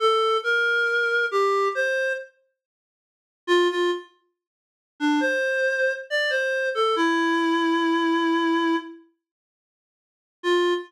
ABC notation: X:1
M:4/4
L:1/16
Q:1/4=69
K:F
V:1 name="Clarinet"
A2 B4 G2 c2 z6 | F F z5 D c4 d c2 A | E10 z6 | F4 z12 |]